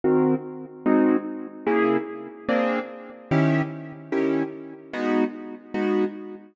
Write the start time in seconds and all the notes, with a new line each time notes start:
0.04 D#3 C4 F#4 A#4
0.86 G#3 C4 D#4 F#4
1.66 C#3 A#3 E4 G#4
2.49 A#3 C4 D4 G#4
3.31 D#3 C#4 E4 G4
4.12 D#3 C#4 E4 G4
4.93 G#3 B3 D#4 F#4
5.74 G#3 B3 D#4 F#4